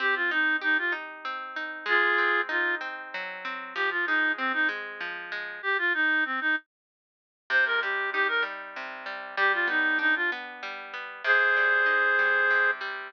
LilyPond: <<
  \new Staff \with { instrumentName = "Clarinet" } { \time 3/4 \key c \minor \tempo 4 = 96 g'16 f'16 ees'8 ees'16 f'16 r4. | <f' aes'>4 f'8 r4. | g'16 f'16 ees'8 c'16 ees'16 r4. | g'16 f'16 ees'8 c'16 ees'16 r4. |
c''16 bes'16 g'8 g'16 bes'16 r4. | g'16 f'16 ees'8 ees'16 f'16 r4. | <aes' c''>2~ <aes' c''>8 r8 | }
  \new Staff \with { instrumentName = "Acoustic Guitar (steel)" } { \time 3/4 \key c \minor c'8 ees'8 g'8 ees'8 c'8 ees'8 | aes8 c'8 ees'8 c'8 ges8 c'8 | f8 aes8 c'8 aes8 f8 aes8 | r2. |
c8 g8 ees'8 g8 c8 g8 | g8 b8 d'8 b8 g8 b8 | c8 g8 ees'8 g8 c8 g8 | }
>>